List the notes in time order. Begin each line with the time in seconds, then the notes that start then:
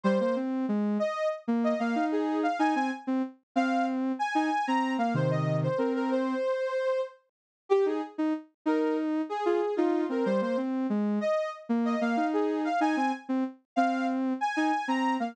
0.03 G3 C5
0.20 A#3 C5
0.36 C4
0.68 G#3
0.99 D#5
1.48 A#3
1.64 D#5
1.79 A#3 F5
1.95 D#4
2.12 G#4
2.43 F5
2.59 D#4 G#5
2.75 C4 G#5
3.07 C4
3.56 C4 F5
4.19 G#5
4.35 D#4 G#5
4.67 C4 A#5
4.98 A#3 F5
5.14 C3 D#3 C5
5.31 D#5
5.63 C5
5.78 C4 A#4
5.95 A#4
6.11 C5
7.69 G4
7.86 D#4 G#4
8.18 D#4
8.66 D#4 A#4
9.29 G#4
9.46 F4 G#4
9.76 D#4 F4
10.09 C4 A#4
10.25 G3 C5
10.41 A#3 C5
10.57 C4
10.90 G#3
11.21 D#5
11.69 A#3
11.85 D#5
12.01 A#3 F5
12.17 D#4
12.33 G#4
12.64 F5
12.81 D#4 G#5
12.97 C4 G#5
13.29 C4
13.76 C4 F5
14.41 G#5
14.56 D#4 G#5
14.88 C4 A#5
15.20 A#3 F5